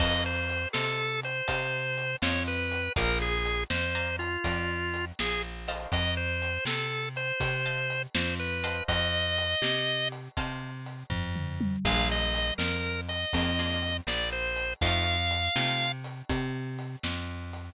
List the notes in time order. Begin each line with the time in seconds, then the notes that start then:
0.00 F2 C5 D#5 F5 A5, kick, crash
0.26 C5
0.49 closed hi-hat
0.73 C3 A4 C5 D#5 F5 A5, snare
1.23 C5, closed hi-hat
1.48 C3 C5 D#5 F5 A5, kick, closed hi-hat
1.98 closed hi-hat
2.22 F2 C5 C#5 D#5 F5 A5, snare
2.48 B4
2.72 closed hi-hat
2.96 A#1 A#4 D5 F5 G#5 A#5, kick, closed hi-hat
3.22 G#4
3.45 closed hi-hat
3.70 F2 C5, snare
3.95 D5 F5 G#5 A#5
4.19 F4, closed hi-hat
4.44 F2 D5 F5 G#5 A#5, kick, closed hi-hat
4.94 closed hi-hat
5.19 A#1 G#4, snare
5.68 C5 D#5 F5 A5, open hi-hat
5.92 F2 D#5, kick, closed hi-hat
6.17 C5
6.42 closed hi-hat
6.65 C3 A4, snare
7.16 C5, closed hi-hat
7.40 C3, kick, closed hi-hat
7.66 C5 D#5 F5 A5
7.90 closed hi-hat
8.15 F2 C5, snare
8.40 B4
8.64 C5 D#5 F5 A5, closed hi-hat
8.88 F2 D#5, kick, closed hi-hat
9.38 closed hi-hat
9.62 C3, snare
10.12 closed hi-hat
10.37 C3 C5 D#5 F5 A5, kick, closed hi-hat
10.86 closed hi-hat
11.10 F2, kick, floor tom
11.36 mid tom
11.61 high tom
11.85 A#1 A#3 D4 F4 G#4 F5, kick, crash
12.12 D#5
12.35 closed hi-hat
12.58 F2 A#4, snare
13.09 D#5, closed hi-hat
13.33 F2 A#3 D4 F4 G#4, kick, closed hi-hat
13.59 A#3 D4 F4 G#4
13.83 closed hi-hat
14.07 A#1 D5, snare
14.32 C5
14.56 closed hi-hat
14.81 F2 A3 C4 D#4 F4 F5, kick, closed hi-hat
15.31 closed hi-hat
15.56 C3 A3 C4 D#4 F4, snare
16.04 closed hi-hat
16.29 C3, kick, closed hi-hat
16.79 closed hi-hat
17.03 F2, snare
17.53 closed hi-hat